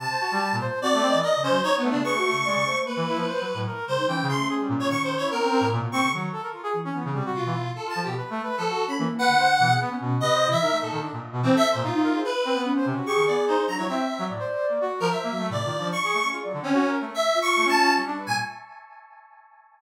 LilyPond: <<
  \new Staff \with { instrumentName = "Lead 1 (square)" } { \time 5/4 \tempo 4 = 147 a''4. r8 d''4 dis''8 c''8 \tuplet 3/2 { cis''8 b8 d'8 } | cis'''2 b'2 r8 c''8 | g''8 c'''8 r8. cis''16 \tuplet 3/2 { cis'''8 c''8 cis''8 } ais'4 r8 cis'''8 | r2. f'4 \tuplet 3/2 { a'8 a''8 g'8 } |
r4 a'8. b''16 r8 fis''4. r4 | dis''8. e''8. a'8 r4 \tuplet 3/2 { c'8 e''8 c''8 } f'4 | b'4 r4 cis'''8 d''8 c''8 ais''16 cis''16 e''4 | r4. r16 ais'16 e''4 d''4 cis'''4 |
r8. cis'8. r8 \tuplet 3/2 { e''4 cis'''4 a''4 } r8. gis''16 | }
  \new Staff \with { instrumentName = "Flute" } { \time 5/4 r2 \tuplet 3/2 { c'8 a'8 dis''8 d''8 cis8 fis8 } r16 cis''16 b8 | \tuplet 3/2 { b'8 fis'8 cis8 } d''8 c''8 ais4 r8. fis16 r8 cis16 dis'16 | cis'1 r16 ais16 r8 | dis8 r4 e8 e8 c8 b,4 r16 a'8 fis'16 |
r4. r16 cis'16 ais8. d8. b,8 b8 cis'8 | c8. e16 dis'4 r2 r16 dis'8 gis'16 | r4 cis'4 gis'4. d'16 e'16 r4 | d''4. r4 fis8 \tuplet 3/2 { c8 f'8 d'8 } r4 |
gis'16 d''16 r2 f'4. g4 | }
  \new Staff \with { instrumentName = "Brass Section" } { \time 5/4 c16 c''16 fis'16 g8 ais,16 c''8 fis'16 a16 c'16 e16 ais'16 r16 cis'16 c''16 dis'8 a16 cis16 | gis'16 a8. gis16 cis16 a16 r8 e16 e'16 f16 \tuplet 3/2 { c''8 fis8 a,8 } ais'8 g16 r16 | \tuplet 3/2 { e8 cis8 a8 } gis'16 g16 ais,8 dis8. e'16 b16 c'16 c'16 a,16 ais,16 b,16 c'16 cis16 | fis8 a'16 ais'16 f'16 gis'16 r16 cis'16 b16 cis16 g16 fis'8 e16 e'16 r8 f'16 f16 b,16 |
\tuplet 3/2 { b'8 a8 b'8 } f16 fis'8 r16 e16 r16 b'8 c''16 r16 e16 gis'16 b16 cis'16 b,8 | \tuplet 3/2 { b'8 c''8 e'8 } ais'16 a16 ais,16 dis16 d'16 ais,8 b,16 e16 a'8 ais,16 dis'8 ais'16 c''16 | r8 c'16 b8 c''16 c16 fis'16 g'16 dis16 b8 dis'16 r16 fis16 fis16 c'8 c'16 fis16 | a,16 c''8. ais16 fis'8 f16 \tuplet 3/2 { c''8 ais8 a8 a,8 dis8 f8 } r16 gis'16 a16 cis'16 |
f'16 fis16 d16 c'16 \tuplet 3/2 { fis'8 ais'8 a8 } r8. f'16 a16 cis'4 d'16 b'16 ais,16 | }
>>